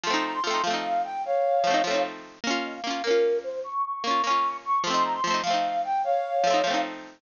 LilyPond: <<
  \new Staff \with { instrumentName = "Flute" } { \time 6/8 \key bes \dorian \tempo 4. = 100 c'''8 bes''16 c'''16 c'''8 f''4 g''8 | <des'' f''>2 r4 | f''8 ees''16 f''16 f''8 bes'4 c''8 | des'''8 des'''16 des'''16 des'''8 des'''4 des'''8 |
c'''8 bes''16 c'''16 c'''8 f''4 g''8 | <des'' f''>2 r4 | }
  \new Staff \with { instrumentName = "Pizzicato Strings" } { \time 6/8 \key bes \dorian <f a c' ees'>4 <f a c' ees'>8 <f a c' ees'>4.~ | <f a c' ees'>4 <f a c' ees'>8 <f a c' ees'>4. | <bes des' f'>4 <bes des' f'>8 <bes des' f'>4.~ | <bes des' f'>4 <bes des' f'>8 <bes des' f'>4. |
<f a c' ees'>4 <f a c' ees'>8 <f a c' ees'>4.~ | <f a c' ees'>4 <f a c' ees'>8 <f a c' ees'>4. | }
>>